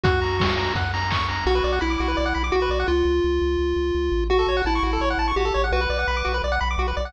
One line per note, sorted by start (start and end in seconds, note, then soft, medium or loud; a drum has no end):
0.04 0.69 F#2 medium
0.04 0.73 F#4 loud
0.04 0.20 F#5 medium
0.04 kick loud
0.04 closed hi-hat loud
0.22 0.38 A#5 medium
0.22 open hi-hat medium
0.39 0.55 C#6 medium
0.39 kick medium
0.39 snare loud
0.57 0.73 A#5 medium
0.57 open hi-hat medium
0.75 1.41 F#2 medium
0.75 0.92 F#5 medium
0.75 kick medium
0.75 closed hi-hat medium
0.94 1.10 A#5 medium
0.94 open hi-hat medium
1.11 1.27 C#6 medium
1.11 kick medium
1.11 clap loud
1.29 1.45 A#5 medium
1.29 open hi-hat medium
1.46 1.61 B1 medium
1.46 1.79 F#4 loud
1.46 1.55 F#4 loud
1.55 1.63 B4 medium
1.64 1.79 B1 medium
1.64 1.72 D5 medium
1.73 1.80 F#5 medium
1.81 1.97 B1 medium
1.81 2.43 E4 loud
1.81 1.89 B5 medium
1.90 1.98 D6 medium
2.00 2.15 B1 medium
2.00 2.08 F#4 medium
2.08 2.16 B4 medium
2.17 2.33 B1 medium
2.17 2.25 D5 medium
2.26 2.34 F#5 medium
2.35 2.51 B1 medium
2.35 2.43 B5 medium
2.44 2.52 D6 medium
2.52 2.68 B1 medium
2.52 2.60 F#4 medium
2.52 2.87 F#4 loud
2.62 2.70 B4 medium
2.69 2.84 B1 medium
2.69 2.79 D5 medium
2.80 2.88 F#5 medium
2.88 3.03 C#2 medium
2.88 4.24 F4 loud
3.05 3.20 C#2 medium
3.24 3.39 C#2 medium
3.42 3.57 C#2 medium
3.59 3.74 C#2 medium
3.76 3.91 C#2 medium
3.95 4.10 C#2 medium
4.12 4.45 A1 medium
4.30 4.38 F#4 loud
4.30 4.62 F#4 loud
4.39 4.47 A4 medium
4.47 4.62 A1 medium
4.47 4.56 C#5 medium
4.57 4.65 F#5 medium
4.65 4.80 A1 medium
4.65 5.32 E4 loud
4.65 4.74 A5 medium
4.75 4.83 C#6 medium
4.83 4.98 A1 medium
4.83 4.91 F#4 medium
4.93 5.01 A4 medium
5.00 5.15 A1 medium
5.00 5.09 C#5 medium
5.10 5.18 F#5 medium
5.18 5.33 A1 medium
5.18 5.27 A5 medium
5.28 5.36 C#6 medium
5.36 5.51 A1 medium
5.36 5.45 F#4 medium
5.36 5.65 G4 loud
5.45 5.53 A4 medium
5.54 5.71 A1 medium
5.54 5.62 C#5 medium
5.64 5.72 F#5 medium
5.72 5.87 B1 medium
5.72 5.81 F#4 loud
5.72 6.38 B4 loud
5.81 5.89 B4 medium
5.90 6.05 B1 medium
5.90 5.98 D5 medium
5.99 6.07 F#5 medium
6.08 6.23 B1 medium
6.08 6.16 B5 medium
6.17 6.25 D6 medium
6.25 6.41 B1 medium
6.25 6.33 F#4 medium
6.34 6.42 B4 medium
6.44 6.59 B1 medium
6.44 6.52 D5 medium
6.52 6.60 F#5 medium
6.61 6.76 B1 medium
6.61 6.69 B5 medium
6.71 6.79 D6 medium
6.78 6.93 B1 medium
6.78 6.87 F#4 medium
6.88 6.96 B4 medium
6.97 7.12 B1 medium
6.97 7.05 D5 medium
7.05 7.13 F#5 medium